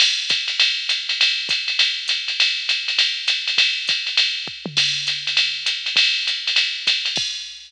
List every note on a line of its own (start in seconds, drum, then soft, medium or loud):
0.00 crash loud
0.00 ride loud
0.29 kick medium
0.29 hi-hat pedal loud
0.29 ride loud
0.48 ride medium
0.60 ride loud
0.89 hi-hat pedal loud
0.89 ride loud
1.09 ride medium
1.21 ride loud
1.49 kick medium
1.49 hi-hat pedal loud
1.49 ride loud
1.68 ride medium
1.79 ride loud
2.08 hi-hat pedal loud
2.08 ride loud
2.28 ride medium
2.40 ride loud
2.69 hi-hat pedal medium
2.69 ride loud
2.88 ride medium
2.99 ride loud
3.28 hi-hat pedal loud
3.28 ride loud
3.48 ride medium
3.58 kick medium
3.58 ride loud
3.87 kick medium
3.87 hi-hat pedal medium
3.87 ride loud
4.07 ride medium
4.17 ride loud
4.48 kick medium
4.66 mid tom loud
4.77 kick medium
4.77 crash loud
4.77 ride loud
5.07 hi-hat pedal loud
5.07 ride medium
5.27 ride medium
5.37 ride loud
5.66 hi-hat pedal loud
5.66 ride loud
5.86 ride medium
5.96 kick medium
5.96 ride loud
6.27 hi-hat pedal medium
6.27 ride medium
6.47 ride medium
6.56 ride loud
6.87 kick medium
6.87 hi-hat pedal medium
6.87 ride loud
7.05 ride medium
7.16 kick loud
7.16 crash loud